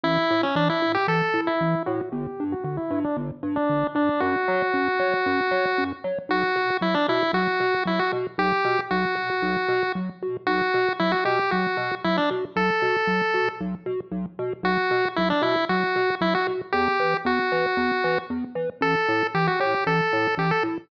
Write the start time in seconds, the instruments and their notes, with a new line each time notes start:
0.04 synth bass 1 A1, lead 1 (square) E4
0.31 synth bass 1 A2
0.43 lead 1 (square) C#4
0.55 synth bass 1 A1, lead 1 (square) D4
0.70 lead 1 (square) E4
0.82 synth bass 1 A2
0.95 lead 1 (square) G4
1.08 synth bass 1 A1, lead 1 (square) A4
1.34 synth bass 1 A2
1.47 lead 1 (square) E4
1.61 synth bass 1 A1
1.86 synth bass 1 A2, lead 1 (square) F#4
2.12 synth bass 1 G1, lead 1 (square) G4
2.40 synth bass 1 G2
2.52 lead 1 (square) F#4
2.64 synth bass 1 G1, lead 1 (square) F#4
2.77 lead 1 (square) E4
2.91 synth bass 1 G2
3.04 lead 1 (square) D4
3.17 synth bass 1 G1
3.43 synth bass 1 G2
3.56 lead 1 (square) D4
3.69 synth bass 1 G1
3.95 synth bass 1 G2, lead 1 (square) D4
4.20 synth bass 1 F#2, lead 1 (square) F#4
4.48 synth bass 1 F#3
4.74 synth bass 1 F#2
4.99 synth bass 1 F#3
5.26 synth bass 1 F#2
5.51 synth bass 1 F#3
5.78 synth bass 1 F#2
6.04 synth bass 1 F#3
6.29 synth bass 1 B1, lead 1 (square) F#4
6.56 synth bass 1 B2
6.81 synth bass 1 B1, lead 1 (square) E4
6.94 lead 1 (square) D4
7.08 synth bass 1 B2, lead 1 (square) E4
7.33 synth bass 1 B1, lead 1 (square) F#4
7.60 synth bass 1 B2
7.85 synth bass 1 B1, lead 1 (square) E4
7.99 lead 1 (square) F#4
8.12 synth bass 1 B2
8.38 synth bass 1 B1, lead 1 (square) G4
8.65 synth bass 1 B2
8.91 synth bass 1 B1, lead 1 (square) F#4
9.15 synth bass 1 B2
9.42 synth bass 1 B1
9.68 synth bass 1 B2
9.95 synth bass 1 B1
10.23 synth bass 1 B2
10.47 synth bass 1 B1, lead 1 (square) F#4
10.74 synth bass 1 B2
10.99 synth bass 1 B1, lead 1 (square) E4
11.12 lead 1 (square) F#4
11.25 synth bass 1 B2, lead 1 (square) G4
11.51 synth bass 1 B1, lead 1 (square) F#4
11.77 synth bass 1 B2
12.04 synth bass 1 B1, lead 1 (square) E4
12.17 lead 1 (square) D4
12.31 synth bass 1 B2
12.56 synth bass 1 B1, lead 1 (square) A4
12.82 synth bass 1 B2
13.07 synth bass 1 B1
13.34 synth bass 1 B2
13.61 synth bass 1 B1
13.86 synth bass 1 B2
14.12 synth bass 1 B1
14.39 synth bass 1 B2
14.63 synth bass 1 B1, lead 1 (square) F#4
14.91 synth bass 1 B2
15.16 synth bass 1 B1, lead 1 (square) E4
15.30 lead 1 (square) D4
15.42 synth bass 1 B2, lead 1 (square) E4
15.69 synth bass 1 B1, lead 1 (square) F#4
15.96 synth bass 1 B2
16.21 synth bass 1 B1, lead 1 (square) E4
16.35 lead 1 (square) F#4
16.47 synth bass 1 B2
16.72 synth bass 1 E2, lead 1 (square) G4
17.00 synth bass 1 E3
17.25 synth bass 1 E2, lead 1 (square) F#4
17.52 synth bass 1 E3
17.77 synth bass 1 E2
18.04 synth bass 1 E3
18.30 synth bass 1 E2
18.55 synth bass 1 E3
18.81 synth bass 1 A1, lead 1 (square) A4
19.09 synth bass 1 A2
19.35 synth bass 1 A1, lead 1 (square) G4
19.47 lead 1 (square) F#4
19.60 synth bass 1 A2, lead 1 (square) G4
19.87 synth bass 1 A1, lead 1 (square) A4
20.13 synth bass 1 A2
20.37 synth bass 1 A1, lead 1 (square) G4
20.51 lead 1 (square) A4
20.63 synth bass 1 A2